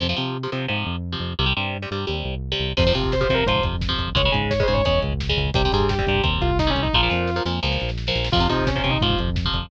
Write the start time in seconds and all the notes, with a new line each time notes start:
0.00 F2 C3 F3
0.09 C3 F3
0.16 C3 F3
0.43 C3 F3
0.52 C3 F3
0.68 G#2 C3 F3
0.86 F2
1.12 C3 F3
1.20 F2
1.39 C2 C3 G3
1.46 C3 G3
1.57 G2 C3 G3
1.82 C3 G3
1.91 G2 C3 G3
2.07 D#2 C3 G3
2.25 C2
2.52 C3 G3
2.60 C2
2.77 F2 C3 F3 C5, kick, crash
2.86 C3 F3, kick
2.94 C3 F3, kick, closed hi-hat
3.03 kick
3.12 C5, kick, snare
3.21 C3 F3 C5, kick
3.29 C3 F3, kick, closed hi-hat
3.34 A#4
3.39 kick
3.46 G#2 C3 F3 C5, kick, closed hi-hat
3.56 kick
3.63 F2, kick, closed hi-hat
3.73 kick
3.81 kick, snare
3.89 C3 F3, kick
3.98 F2, kick, closed hi-hat
4.08 kick
4.15 C#2 C#3 G#3 C#5, kick, closed hi-hat
4.25 C#3 G#3, kick
4.32 G#2 C#3 G#3, kick, closed hi-hat
4.42 kick
4.50 C#5, kick, snare
4.60 C#3 G#3 C5, kick
4.68 G#2 C#3 G#3, kick, closed hi-hat
4.73 C#5, kick
4.85 E2 C#3 G#3 C#5, kick, closed hi-hat
4.94 kick
5.02 C#2, kick, closed hi-hat
5.12 kick
5.20 kick, snare
5.29 C#3 G#3, kick
5.37 C#2, kick, closed hi-hat
5.46 kick
5.54 C2 C3 G3 G4, kick, closed hi-hat
5.64 C3 G3, kick
5.72 G2 C3 G3 G#4, kick, closed hi-hat
5.80 kick
5.89 G4, kick, snare
5.99 C3 G3, kick
6.07 G2 C3 G3, kick, closed hi-hat
6.15 kick
6.23 D#2 C3 G3, kick, closed hi-hat
6.33 kick
6.41 C2 F4, kick, closed hi-hat
6.49 kick
6.59 D#4, kick, snare
6.67 C3 G3 C#4, kick
6.75 C2, kick, closed hi-hat
6.83 D#4, kick
6.93 A#1 A#2 F3 F4, kick, snare
7.03 A#2 F3
7.10 F2 A#2 F3, snare
7.27 snare
7.36 A#2 F3
7.45 F2 A#2 F3, snare
7.63 C#2 A#2 F3, snare
7.72 snare
7.80 A#1, snare
7.89 snare
7.98 snare
8.07 A#2 F3, snare
8.15 A#1, snare
8.24 snare
8.32 F2 C3 F3 F4, kick, crash
8.40 C3 F3, kick
8.49 C3 F3 D#4, kick, closed hi-hat
8.59 kick
8.67 C#4, kick, snare
8.76 C3 F3 C#4, kick
8.84 C3 F3, kick, closed hi-hat
8.90 D#4, kick
9.01 G#2 C3 F3 F4, kick, closed hi-hat
9.10 kick
9.18 F2, kick, closed hi-hat
9.28 kick
9.36 kick, snare
9.45 C3 F3, kick
9.54 F2, kick, closed hi-hat
9.63 kick